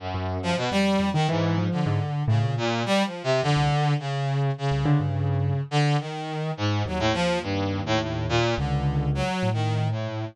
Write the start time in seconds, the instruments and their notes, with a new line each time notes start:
0.00 brass section F#2
0.14 acoustic grand piano F#2
0.43 brass section F3
0.57 brass section B2
0.71 acoustic grand piano F2, brass section G3
1.00 acoustic grand piano F2
1.14 brass section D#3, acoustic grand piano D#3
1.29 brass section G#2, acoustic grand piano E3
1.58 acoustic grand piano F3
1.72 brass section D3
1.86 acoustic grand piano G#2
2.28 acoustic grand piano A2, brass section C#3
2.43 acoustic grand piano A#2
2.57 brass section A#2
2.86 brass section G3
3.05 brass section F3
3.24 brass section C3
3.43 acoustic grand piano F2, brass section D3
3.57 acoustic grand piano C2
3.99 brass section C#3
4.58 brass section C#3
4.71 acoustic grand piano C2
4.85 acoustic grand piano D3
5.00 acoustic grand piano G2
5.71 brass section D3
6.00 brass section D#3
6.57 brass section G#2
6.86 acoustic grand piano D#2, brass section F#3
6.99 brass section A2
7.13 brass section F3
7.42 brass section G2
7.86 brass section A2
8.00 brass section A2
8.29 brass section A#2
8.58 acoustic grand piano C#2, brass section D3
9.15 brass section F#3
9.43 acoustic grand piano A2
9.53 brass section D#3
9.91 brass section A2